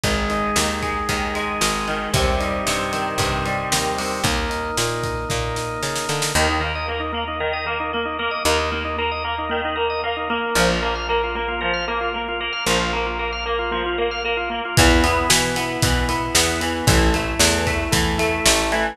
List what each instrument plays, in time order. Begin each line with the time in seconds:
0.04 electric bass (finger) G#1, overdriven guitar D#3, drawbar organ G#3, kick, closed hi-hat
0.29 overdriven guitar G#3, drawbar organ D#4, closed hi-hat
0.56 electric bass (finger) D#2, overdriven guitar D#3, drawbar organ G#3, snare
0.82 overdriven guitar G#3, drawbar organ D#4, kick, closed hi-hat
1.09 electric bass (finger) D#2, overdriven guitar D#3, drawbar organ G#3, kick, closed hi-hat
1.35 overdriven guitar G#3, drawbar organ D#4, closed hi-hat
1.61 electric bass (finger) G#1, overdriven guitar G#3, drawbar organ D#4, snare
1.88 overdriven guitar D#3, drawbar organ G#3, closed hi-hat
2.14 electric bass (finger) D#2, overdriven guitar C3, drawbar organ G3, kick, closed hi-hat
2.40 overdriven guitar G3, drawbar organ D#4, closed hi-hat
2.66 electric bass (finger) G2, overdriven guitar C3, drawbar organ G3, snare
2.92 overdriven guitar D#3, drawbar organ C4, closed hi-hat
3.18 electric bass (finger) G2, overdriven guitar C3, drawbar organ G3, kick, closed hi-hat
3.46 overdriven guitar G3, drawbar organ D#4, closed hi-hat
3.71 electric bass (finger) D#2, overdriven guitar D#3, drawbar organ C4, snare
3.98 overdriven guitar C3, drawbar organ G3, open hi-hat
4.24 electric bass (finger) D#2, drawbar organ A#3, kick, closed hi-hat
4.49 drawbar organ D#4, closed hi-hat
4.77 electric bass (finger) A#2, drawbar organ A#3, snare
5.03 drawbar organ D#4, kick, closed hi-hat
5.29 electric bass (finger) A#2, drawbar organ A#3, kick, snare
5.56 drawbar organ D#4, snare
5.82 electric bass (finger) C#3, drawbar organ D#4, snare
5.96 snare
6.08 electric bass (finger) D3, drawbar organ A#3, snare
6.22 snare
6.35 electric bass (finger) D#2, overdriven guitar D#3, drawbar organ A#3
6.49 drawbar organ D#4
6.61 overdriven guitar A#3, drawbar organ A#4
6.75 drawbar organ D#5
6.88 overdriven guitar A#3, drawbar organ A#4
7.00 drawbar organ D#4
7.12 drawbar organ A#3, overdriven guitar A#3
7.28 drawbar organ D#4
7.40 overdriven guitar D#3, drawbar organ A#4
7.53 drawbar organ D#5
7.66 overdriven guitar A#3, drawbar organ A#4
7.80 drawbar organ D#4
7.93 overdriven guitar A#3, drawbar organ A#3
8.05 drawbar organ D#4
8.19 overdriven guitar A#3, drawbar organ A#4
8.31 drawbar organ D#5
8.45 electric bass (finger) D#2, overdriven guitar D#3, drawbar organ A#4
8.59 drawbar organ D#4
8.72 drawbar organ A#3, overdriven guitar A#3
8.85 drawbar organ D#4
8.98 overdriven guitar A#3, drawbar organ A#4
9.11 drawbar organ D#5
9.24 overdriven guitar A#3, drawbar organ A#4
9.38 drawbar organ D#4
9.49 overdriven guitar D#3, drawbar organ A#3
9.65 drawbar organ D#4
9.76 overdriven guitar A#3, drawbar organ A#4
9.90 drawbar organ D#5
10.04 overdriven guitar A#3, drawbar organ A#4
10.17 drawbar organ D#4
10.30 overdriven guitar A#3, drawbar organ A#3
10.55 electric bass (finger) A#1, overdriven guitar F3
10.69 drawbar organ F4
10.82 overdriven guitar A#3, drawbar organ A#4
10.95 drawbar organ F5
11.09 overdriven guitar A#3, drawbar organ A#4
11.24 drawbar organ F4
11.35 overdriven guitar A#3, drawbar organ A#3
11.48 drawbar organ F4
11.61 overdriven guitar F3, drawbar organ A#4
11.73 drawbar organ F5
11.88 overdriven guitar A#3, drawbar organ A#4
12.01 drawbar organ F4
12.14 overdriven guitar A#3, drawbar organ A#3
12.28 drawbar organ F4
12.40 overdriven guitar A#3, drawbar organ A#4
12.53 drawbar organ F5
12.66 electric bass (finger) A#1, overdriven guitar F3, drawbar organ A#4
12.80 drawbar organ F4
12.93 overdriven guitar A#3, drawbar organ A#3
13.06 drawbar organ F4
13.19 overdriven guitar A#3, drawbar organ A#4
13.32 drawbar organ F5
13.46 overdriven guitar A#3, drawbar organ A#4
13.59 drawbar organ F4
13.71 overdriven guitar F3, drawbar organ A#3
13.86 drawbar organ F4
13.98 overdriven guitar A#3, drawbar organ A#4
14.11 drawbar organ F5
14.24 overdriven guitar A#3, drawbar organ A#4
14.37 drawbar organ F4
14.50 drawbar organ A#3, overdriven guitar A#3
14.65 drawbar organ F4
14.77 electric bass (finger) E2, overdriven guitar E3, drawbar organ B3, kick, closed hi-hat
15.03 overdriven guitar B3, drawbar organ E4, closed hi-hat
15.29 electric bass (finger) B2, overdriven guitar E3, drawbar organ B3, snare
15.56 overdriven guitar B3, drawbar organ E4, closed hi-hat
15.82 electric bass (finger) B2, overdriven guitar E3, drawbar organ B3, kick, closed hi-hat
16.09 overdriven guitar B3, drawbar organ E4, closed hi-hat
16.34 electric bass (finger) E2, overdriven guitar B3, drawbar organ E4, snare
16.60 overdriven guitar E3, drawbar organ B3, closed hi-hat
16.87 electric bass (finger) A1, overdriven guitar E3, drawbar organ A3, kick, closed hi-hat
17.14 overdriven guitar A3, drawbar organ E4, closed hi-hat
17.39 electric bass (finger) E2, overdriven guitar E3, drawbar organ A3, snare
17.67 overdriven guitar A3, drawbar organ E4, kick, closed hi-hat
17.91 electric bass (finger) E2, overdriven guitar E3, drawbar organ A3, kick, closed hi-hat
18.18 overdriven guitar A3, drawbar organ E4, closed hi-hat
18.45 electric bass (finger) A1, overdriven guitar A3, drawbar organ E4, snare
18.72 overdriven guitar E3, drawbar organ A3, closed hi-hat